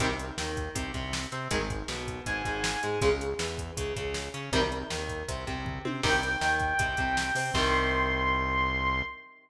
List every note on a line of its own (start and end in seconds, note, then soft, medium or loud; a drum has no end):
0.00 0.32 C2 medium
0.00 0.08 C3 loud
0.00 0.08 D#3 loud
0.00 0.08 G3 loud
0.00 kick loud
0.00 closed hi-hat loud
0.19 closed hi-hat medium
0.37 0.69 D#2 medium
0.37 0.70 D#3 medium
0.37 snare loud
0.57 kick medium
0.57 closed hi-hat medium
0.75 0.92 C2 medium
0.75 0.91 C3 medium
0.75 kick loud
0.75 closed hi-hat loud
0.94 1.27 C2 medium
0.94 1.26 C3 medium
0.94 kick medium
0.94 closed hi-hat medium
1.13 snare loud
1.32 1.48 C3 medium
1.32 1.48 C4 medium
1.32 closed hi-hat medium
1.51 1.83 G#1 medium
1.51 1.59 D#3 loud
1.51 1.59 G#3 loud
1.51 kick loud
1.51 closed hi-hat loud
1.70 kick loud
1.70 closed hi-hat medium
1.88 2.20 B1 medium
1.88 2.21 B2 medium
1.88 snare loud
2.08 kick medium
2.08 closed hi-hat medium
2.26 2.42 G#1 medium
2.26 2.43 G#2 medium
2.26 3.00 G#5 medium
2.26 kick medium
2.26 closed hi-hat loud
2.45 2.77 G#1 medium
2.45 2.78 G#2 medium
2.45 kick medium
2.45 closed hi-hat medium
2.64 snare loud
2.83 3.00 G#2 medium
2.83 2.99 G#3 medium
2.83 closed hi-hat medium
3.01 3.34 C#2 medium
3.01 3.10 C#3 loud
3.01 3.10 G#3 loud
3.01 kick loud
3.01 closed hi-hat loud
3.21 closed hi-hat medium
3.39 3.71 E2 medium
3.39 3.72 E3 medium
3.39 snare loud
3.58 kick medium
3.58 closed hi-hat medium
3.77 3.93 C#2 medium
3.77 3.94 C#3 medium
3.77 kick medium
3.77 closed hi-hat loud
3.96 4.29 C#2 medium
3.96 4.28 C#3 medium
3.96 kick loud
3.96 closed hi-hat medium
4.14 snare loud
4.34 4.50 C#3 medium
4.34 4.50 C#4 medium
4.34 closed hi-hat medium
4.52 4.84 C2 medium
4.52 4.60 C3 loud
4.52 4.60 D#3 loud
4.52 4.60 G3 loud
4.52 kick loud
4.52 closed hi-hat loud
4.72 closed hi-hat medium
4.90 5.24 D#2 medium
4.90 5.22 D#3 medium
4.90 snare loud
5.09 kick medium
5.09 closed hi-hat medium
5.28 5.45 C2 medium
5.28 5.44 C3 medium
5.28 kick medium
5.28 closed hi-hat loud
5.47 5.79 C2 medium
5.47 5.79 C3 medium
5.47 kick medium
5.47 closed hi-hat medium
5.65 kick loud
5.65 floor tom loud
5.85 6.01 C3 medium
5.85 6.01 C4 medium
5.85 high tom loud
6.03 6.36 C2 medium
6.03 6.11 C3 loud
6.03 6.11 D#3 loud
6.03 6.11 G3 loud
6.03 7.50 G5 medium
6.03 kick loud
6.03 crash loud
6.23 closed hi-hat medium
6.41 6.74 D#2 medium
6.41 6.73 D#3 medium
6.41 snare loud
6.60 kick medium
6.60 closed hi-hat medium
6.79 6.95 C2 medium
6.79 6.95 C3 medium
6.79 kick loud
6.79 closed hi-hat loud
6.97 7.31 C2 medium
6.97 7.30 C3 medium
6.97 kick loud
6.97 closed hi-hat medium
7.17 snare loud
7.35 7.51 C3 medium
7.35 7.52 C4 medium
7.35 open hi-hat loud
7.54 9.02 C2 loud
7.54 9.03 C3 medium
7.54 9.03 D#3 loud
7.54 9.03 G3 loud
7.54 9.01 C6 loud
7.54 kick loud
7.54 crash loud